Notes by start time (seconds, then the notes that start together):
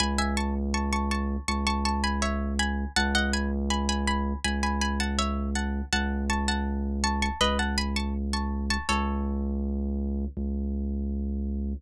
0.00 C#2 G#5 B5
0.18 E5 G#5
0.37 A5 C#6
0.74 A5 C#6
0.93 A5 C#6
1.11 A5 C#6
1.48 C#2 A5 C#6
1.67 A5 C#6
1.85 A5 C#6
2.04 G#5 B5
2.22 C#5 E5
2.59 G#5 B5
2.96 C#2 F#5 A5
3.15 D#5 F#5
3.33 G#5 B5
3.70 G#5 B5
3.89 G#5 B5
4.07 G#5 B5
4.44 C#2 G#5 B5
4.63 G#5 B5
4.81 G#5 B5
5.00 F#5 A5
5.19 C#5 E5
5.55 F#5 A5
5.93 C#2 F#5 A5
6.30 A5 C#6
6.48 F#5 A5
7.04 A5 C#6
7.22 A5 C#6
7.41 C#2 B4 D#5
7.59 F#5 A5
7.78 G#5 B5
7.96 A5 C#6
8.33 A5 C#6
8.70 A5 C#6
8.89 C#2 A4 C#5
10.37 C#2